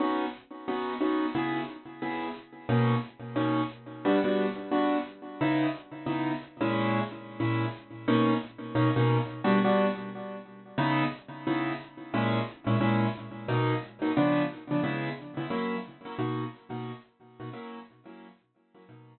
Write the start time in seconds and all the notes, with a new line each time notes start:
0.00 B3 C#4 D#4 F#4
0.68 B3 C#4 D#4 F#4
1.01 B3 C#4 D#4 F#4
1.35 C#3 B3 E4 G#4
2.02 C#3 B3 E4 G#4
2.69 B2 A#3 C#4 D#4
3.36 B2 A#3 C#4 D#4
4.05 G3 B3 D4 F#4
4.24 G3 B3 D4 F#4
4.71 G3 B3 D4 F#4
5.41 C#3 B3 D#4 E4
6.06 C#3 B3 D#4 E4
6.61 A#2 G#3 C#4 E4
7.40 A#2 G#3 C#4 E4
8.08 B2 A#3 C#4 D#4
8.75 B2 A#3 C#4 D#4
8.96 B2 A#3 C#4 D#4
9.44 G3 B3 D4 F#4
9.64 G3 B3 D4 F#4
10.78 C#3 B3 D#4 E4
11.47 C#3 B3 D#4 E4
12.14 A#2 G#3 C#4 E4
12.67 A#2 G#3 C#4 E4
12.80 A#2 G#3 C#4 E4
13.48 B2 F#3 A#3 D#4
14.02 B2 F#3 A#3 D#4
14.17 C#3 F3 B3 D4
14.71 C#3 F3 B3 D4
14.83 C#3 G#3 B3 E4
15.37 C#3 G#3 B3 E4
15.50 F#3 A#3 C#4 E4
16.05 F#3 A#3 C#4 E4
16.19 B2 A#3 D#4 F#4
16.70 B2 A#3 D#4 F#4
17.40 B2 A#3 D#4 F#4
17.53 F#3 A#3 C#4 E4
18.05 F#3 A#3 C#4 E4
18.74 F#3 A#3 C#4 E4
18.89 B2 F#3 A#3 D#4